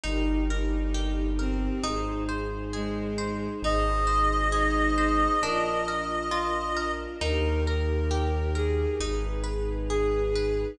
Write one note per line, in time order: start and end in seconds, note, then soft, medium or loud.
0.04 1.69 G1 loud
0.04 0.41 D#4 loud
0.04 0.44 D#4 loud
0.04 1.82 D#4 medium
0.04 1.82 G4 medium
0.04 1.82 A#4 medium
0.49 1.26 D#4 medium
0.49 0.90 A#4 medium
0.94 1.35 G4 medium
1.39 1.83 C4 loud
1.39 1.79 A#4 medium
1.83 3.49 G#1 loud
1.83 2.24 D#4 loud
1.83 3.61 D#4 medium
1.83 3.61 G#4 medium
1.83 3.61 C5 medium
2.29 2.69 C5 medium
2.73 3.48 G#3 medium
2.73 3.13 G#4 medium
3.18 3.58 C5 medium
3.62 5.27 G#1 loud
3.62 5.40 D#4 medium
3.62 4.04 D#4 medium
3.62 5.40 G#4 medium
3.62 5.40 C5 medium
3.62 6.91 D#5 medium
4.07 4.47 C5 medium
4.52 4.92 D#4 loud
4.52 4.93 G#4 medium
4.96 5.35 D#4 loud
4.96 5.38 C5 medium
5.42 7.07 A#1 medium
5.42 7.19 D4 medium
5.42 5.83 D4 loud
5.42 7.19 F4 medium
5.42 5.79 A#4 loud
5.42 7.19 A#4 medium
5.88 6.28 A#4 medium
6.31 6.72 F4 loud
6.76 7.17 A#4 medium
7.21 8.86 D#2 loud
7.21 7.61 D#4 loud
7.21 8.98 D#4 medium
7.21 8.98 G4 medium
7.21 7.64 A#4 loud
7.21 8.98 A#4 medium
7.66 8.52 A#4 loud
7.66 8.07 A#4 medium
8.11 8.51 G4 medium
8.55 8.96 G#4 loud
8.55 8.96 A#4 medium
9.00 10.65 G#1 loud
9.00 10.77 D#4 medium
9.00 9.41 D#4 loud
9.00 10.77 G#4 medium
9.00 10.77 B4 medium
9.44 9.84 B4 medium
9.89 10.61 G#4 loud
9.89 10.30 G#4 medium
10.35 10.76 B4 medium